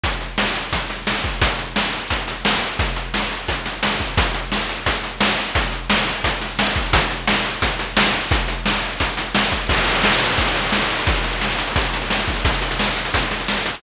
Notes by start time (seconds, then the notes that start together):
0.04 kick, closed hi-hat
0.21 closed hi-hat
0.38 snare
0.55 closed hi-hat
0.73 kick, closed hi-hat
0.90 snare, closed hi-hat
1.07 snare
1.24 kick, closed hi-hat
1.42 kick, closed hi-hat
1.59 closed hi-hat
1.76 snare
1.93 closed hi-hat
2.10 kick, closed hi-hat
2.28 snare, closed hi-hat
2.45 snare
2.62 closed hi-hat
2.79 kick, closed hi-hat
2.96 closed hi-hat
3.14 snare
3.31 closed hi-hat
3.48 kick, closed hi-hat
3.65 snare, closed hi-hat
3.83 snare
4.00 kick, closed hi-hat
4.17 kick, closed hi-hat
4.34 closed hi-hat
4.52 snare
4.69 closed hi-hat
4.86 kick, closed hi-hat
5.03 snare, closed hi-hat
5.21 snare
5.38 closed hi-hat
5.55 kick, closed hi-hat
5.72 closed hi-hat
5.90 snare
6.07 closed hi-hat
6.24 kick, closed hi-hat
6.41 snare, closed hi-hat
6.59 snare
6.76 kick, closed hi-hat
6.93 kick, closed hi-hat
7.11 closed hi-hat
7.28 snare
7.45 closed hi-hat
7.62 kick, closed hi-hat
7.79 snare, closed hi-hat
7.97 snare
8.14 closed hi-hat
8.31 kick, closed hi-hat
8.48 closed hi-hat
8.66 snare
8.83 closed hi-hat
9.00 kick, closed hi-hat
9.17 snare, closed hi-hat
9.35 snare
9.52 kick, closed hi-hat
9.69 kick, crash
9.78 closed hi-hat
9.86 closed hi-hat
9.95 closed hi-hat
10.04 snare
10.12 closed hi-hat
10.21 closed hi-hat
10.29 closed hi-hat
10.38 kick, closed hi-hat
10.47 closed hi-hat
10.55 snare, closed hi-hat
10.64 closed hi-hat
10.72 snare
10.81 closed hi-hat
10.90 closed hi-hat
10.98 closed hi-hat
11.07 kick, closed hi-hat
11.16 closed hi-hat
11.24 closed hi-hat
11.33 closed hi-hat
11.41 snare
11.50 closed hi-hat
11.59 closed hi-hat
11.67 closed hi-hat
11.76 kick, closed hi-hat
11.84 closed hi-hat
11.93 snare, closed hi-hat
12.02 closed hi-hat
12.10 snare
12.19 closed hi-hat
12.28 kick, closed hi-hat
12.36 closed hi-hat
12.45 kick, closed hi-hat
12.54 closed hi-hat
12.62 closed hi-hat
12.71 closed hi-hat
12.79 snare
12.88 closed hi-hat
12.97 closed hi-hat
13.05 closed hi-hat
13.14 kick, closed hi-hat
13.22 closed hi-hat
13.31 snare, closed hi-hat
13.40 closed hi-hat
13.48 snare
13.57 closed hi-hat
13.66 closed hi-hat
13.74 closed hi-hat